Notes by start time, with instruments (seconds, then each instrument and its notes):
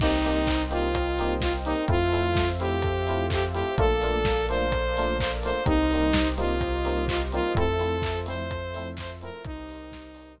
0.00 synth bass 2 C2, electric piano 2 A#3 C4 D#4 G4, lead 2 (sawtooth) D#4, pad 2 (warm) A#4 C5 D#5 G5, kick, crash
0.24 electric piano 2 A#3 C4 D#4 G4, open hi-hat
0.47 kick, clap
0.70 electric piano 2 A#3 C4 D#4 G4, lead 2 (sawtooth) F4, open hi-hat
0.95 kick, closed hi-hat
1.19 electric piano 2 A#3 C4 D#4 G4, open hi-hat
1.41 lead 2 (sawtooth) F4, kick, snare
1.65 electric piano 2 A#3 C4 D#4 G4, lead 2 (sawtooth) D#4, open hi-hat
1.88 synth bass 2 F2, electric piano 2 A3 C4 E4 F4, lead 2 (sawtooth) F4, pad 2 (warm) A4 C5 E5 F5, kick, closed hi-hat
2.12 electric piano 2 A3 C4 E4 F4, open hi-hat
2.35 kick, snare
2.60 electric piano 2 A3 C4 E4 F4, lead 2 (sawtooth) G4, open hi-hat
2.82 kick, closed hi-hat
3.07 electric piano 2 A3 C4 E4 F4, open hi-hat
3.30 lead 2 (sawtooth) G4, kick, clap
3.53 electric piano 2 A3 C4 E4 F4, lead 2 (sawtooth) G4, open hi-hat
3.78 synth bass 2 A#1, electric piano 2 A3 A#3 D4 F4, pad 2 (warm) A4 A#4 D5 F5, lead 2 (sawtooth) A4, kick, closed hi-hat
4.01 electric piano 2 A3 A#3 D4 F4, open hi-hat
4.25 kick, snare
4.49 electric piano 2 A3 A#3 D4 F4, lead 2 (sawtooth) C5, open hi-hat
4.72 kick, closed hi-hat
4.97 electric piano 2 A3 A#3 D4 F4, open hi-hat
5.19 lead 2 (sawtooth) C5, kick, clap
5.43 electric piano 2 A3 A#3 D4 F4, lead 2 (sawtooth) C5, open hi-hat
5.65 synth bass 2 C2, electric piano 2 G3 A#3 C4 D#4, lead 2 (sawtooth) D#4, pad 2 (warm) G4 A#4 C5 D#5, kick, closed hi-hat
5.91 electric piano 2 G3 A#3 C4 D#4, open hi-hat
6.13 kick, snare
6.37 electric piano 2 G3 A#3 C4 D#4, lead 2 (sawtooth) F4, open hi-hat
6.61 kick, closed hi-hat
6.85 electric piano 2 G3 A#3 C4 D#4, open hi-hat
7.08 lead 2 (sawtooth) F4, kick, clap
7.32 electric piano 2 G3 A#3 C4 D#4, lead 2 (sawtooth) F4, open hi-hat
7.55 synth bass 2 F2, electric piano 2 F3 A3 C4 E4, pad 2 (warm) F4 A4 C5 E5, lead 2 (sawtooth) A4, kick, closed hi-hat
7.79 electric piano 2 F3 A3 C4 E4, open hi-hat
8.02 kick, clap
8.26 electric piano 2 F3 A3 C4 E4, lead 2 (sawtooth) C5, open hi-hat
8.51 kick, closed hi-hat
8.74 electric piano 2 F3 A3 C4 E4, open hi-hat
8.97 lead 2 (sawtooth) C5, kick, clap
9.21 electric piano 2 F3 A3 C4 E4, lead 2 (sawtooth) A#4, open hi-hat
9.44 synth bass 2 C2, lead 2 (sawtooth) D#4, pad 2 (warm) G4 A#4 C5 D#5, kick, closed hi-hat
9.69 open hi-hat
9.92 kick, snare
10.15 open hi-hat
10.38 kick